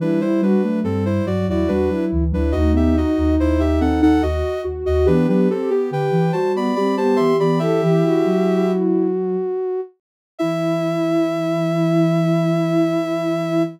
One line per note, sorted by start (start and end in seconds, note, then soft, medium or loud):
0.00 0.19 E3 loud
0.00 0.55 G3 loud
0.00 0.21 D4 medium
0.00 0.20 E4 loud
0.00 0.21 B4 medium
0.21 0.41 G3 medium
0.21 0.41 E4 medium
0.21 0.41 C5 medium
0.42 0.62 G3 medium
0.42 0.80 D4 medium
0.42 0.62 F#4 loud
0.42 0.80 B4 medium
0.62 0.82 F#3 medium
0.62 0.84 A3 loud
0.84 1.19 G2 medium
0.84 1.22 G3 medium
0.84 1.04 C4 medium
0.84 1.04 A4 medium
1.05 1.26 E4 medium
1.05 1.26 C5 medium
1.26 1.46 G2 loud
1.26 1.63 F#3 medium
1.26 1.46 F#4 medium
1.26 1.46 D5 medium
1.47 1.67 E2 loud
1.47 1.68 E4 loud
1.47 1.70 F#4 medium
1.47 1.70 D5 medium
1.68 1.88 E2 medium
1.68 1.90 G3 medium
1.68 2.05 D4 medium
1.68 1.89 F#4 loud
1.68 2.05 B4 medium
1.90 2.11 F#3 medium
1.90 2.24 E4 medium
2.12 2.32 D2 medium
2.12 2.33 E3 medium
2.32 2.53 D2 loud
2.32 2.52 F#3 medium
2.32 2.54 D4 medium
2.32 2.52 E4 medium
2.32 2.54 B4 medium
2.52 3.04 D#2 loud
2.52 2.73 A3 medium
2.52 4.05 D#4 loud
2.52 2.72 F#4 medium
2.52 2.72 D#5 medium
2.73 2.93 B3 medium
2.73 2.96 G4 medium
2.73 2.96 E5 medium
2.95 3.36 D#4 loud
2.95 3.35 F#4 medium
2.95 3.35 D#5 medium
3.17 3.37 D#2 loud
3.39 3.80 D#2 loud
3.39 3.60 E4 medium
3.39 3.60 C5 medium
3.60 3.80 G4 medium
3.60 3.80 E5 medium
3.81 4.01 D#2 loud
3.81 4.01 C4 medium
3.81 4.01 A4 medium
3.81 4.01 F#5 medium
4.01 4.21 D#2 loud
4.01 4.22 D#4 loud
4.01 4.22 A4 medium
4.01 4.22 F#5 medium
4.22 4.43 D#2 loud
4.22 4.61 F#4 medium
4.22 4.63 F#4 loud
4.22 4.61 D#5 medium
4.64 4.84 D#2 medium
4.64 4.84 F#4 medium
4.85 5.07 D#2 medium
4.85 5.05 F#4 loud
4.85 5.06 F#4 medium
4.85 5.06 D#5 medium
5.06 5.27 E3 loud
5.06 5.27 B3 loud
5.06 5.27 D4 medium
5.06 5.26 G4 loud
5.06 5.27 B4 medium
5.28 5.48 F#3 loud
5.28 5.48 B3 loud
5.28 5.49 D4 medium
5.28 5.48 G4 medium
5.28 5.49 B4 medium
5.49 5.69 C4 medium
5.49 5.70 C4 medium
5.49 5.70 G4 loud
5.49 5.70 A4 medium
5.70 5.90 B3 medium
5.70 5.90 G4 medium
5.70 5.91 G4 loud
5.91 6.11 D3 loud
5.91 6.31 G4 medium
5.91 6.32 B4 medium
5.91 6.32 G5 medium
6.11 6.31 E3 loud
6.32 6.70 G3 loud
6.32 6.72 F#4 medium
6.32 6.52 C5 medium
6.32 6.52 A5 medium
6.55 6.75 B3 loud
6.55 6.75 D5 medium
6.55 6.75 B5 medium
6.75 7.15 G3 medium
6.75 6.96 C4 medium
6.75 6.97 G4 medium
6.75 6.95 D5 medium
6.75 6.95 B5 medium
6.97 7.33 B3 loud
6.97 7.18 G4 medium
6.97 7.17 C5 medium
6.97 7.17 A5 medium
7.16 7.39 E3 medium
7.16 7.38 G4 loud
7.16 7.36 E5 medium
7.16 7.36 C6 medium
7.39 7.59 E3 loud
7.39 7.60 B3 medium
7.39 7.61 G4 medium
7.39 7.60 D5 medium
7.39 7.60 B5 medium
7.59 7.81 E3 loud
7.59 9.08 E4 medium
7.59 8.71 G4 medium
7.59 7.81 A4 loud
7.59 8.71 E5 medium
7.82 8.03 E3 loud
7.82 8.02 G4 loud
8.03 8.25 E3 loud
8.03 9.81 F#4 loud
8.24 9.36 F#3 loud
10.38 13.65 E3 loud
10.38 13.63 E4 loud
10.38 13.62 E5 loud